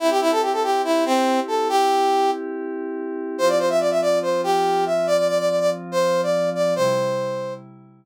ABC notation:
X:1
M:4/4
L:1/16
Q:1/4=142
K:C
V:1 name="Brass Section"
E G E A G A G2 E2 C4 A2 | G6 z10 | c d c e d e d2 c2 G4 e2 | d d d d d d z2 c3 d3 d2 |
c8 z8 |]
V:2 name="Pad 5 (bowed)"
[CEG]16- | [CEG]16 | [F,CF]16- | [F,CF]16 |
[C,G,E]16 |]